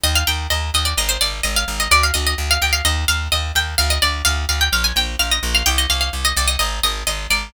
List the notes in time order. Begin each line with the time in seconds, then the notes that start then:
0.04 D#2 D#5
0.15 F5
0.27 D#2 G5
0.50 D#2 D#5
0.74 D#2 D#5
0.85 D5
0.97 G#1 D#5
1.09 C5
1.21 G#1 D5
1.43 G#1 D#5
1.56 F5
1.68 G#1
1.80 D#5
1.91 D2 D5
2.03 F5
2.14 D2 D#5
2.27 D#5
2.38 D2
2.51 F5
2.62 D2 G5
2.73 F5
2.85 D#2 D#5
3.08 D#2 F5
3.32 D#2 D#5
3.55 D#2 G5
3.78 D2 F5
3.90 D#5
4.02 D2 D5
4.25 D2 F5
4.49 D2 F5
4.61 G5
4.72 A#1 F5
4.84 G#5
4.96 A#1 G5
5.19 A#1 F5
5.31 D#5
5.43 A#1
5.55 F5
5.66 C2 G5
5.78 D#5
5.90 C2 F5
6.01 F5
6.13 C2
6.25 D#5
6.36 C2 D5
6.48 D#5
6.59 G#1 D#5
6.83 G#1 D#5
7.07 G#1 D#5
7.30 G#1 D5